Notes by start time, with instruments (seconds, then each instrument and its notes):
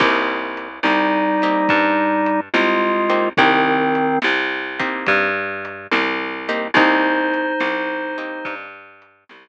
0.00 electric bass (finger) C2, acoustic guitar (steel) A#3 C4 D#4 G4, kick, crash
0.57 closed hi-hat
0.83 electric bass (finger) C2, drawbar organ G3 D#4, snare
1.42 acoustic guitar (steel) A#3 C4 D#4 G4, closed hi-hat
1.69 electric bass (finger) G2, kick, closed hi-hat
2.26 closed hi-hat
2.54 electric bass (finger) C2, drawbar organ G#3 F4, snare
3.10 acoustic guitar (steel) A#3 C4 D#4 G4, closed hi-hat
3.37 electric bass (finger) C2, drawbar organ D#3 C4, acoustic guitar (steel) A#3 C4 D#4 G4, kick, closed hi-hat
3.95 closed hi-hat
4.22 electric bass (finger) C2, snare
4.79 acoustic guitar (steel) A#3 C4 D#4 G4, kick, closed hi-hat
5.07 electric bass (finger) G2, kick, closed hi-hat
5.65 closed hi-hat
5.92 electric bass (finger) C2, snare
6.49 acoustic guitar (steel) A#3 C4 D#4 G4, closed hi-hat
6.74 electric bass (finger) C2, acoustic guitar (steel) A#3 C4 D#4 G4, drawbar organ D#4 C5, kick, closed hi-hat
7.34 closed hi-hat
7.60 electric bass (finger) C2, snare
8.18 acoustic guitar (steel) A#3 C4 D#4 G4, closed hi-hat
8.45 electric bass (finger) G2, kick, closed hi-hat
9.02 closed hi-hat
9.29 electric bass (finger) C2, snare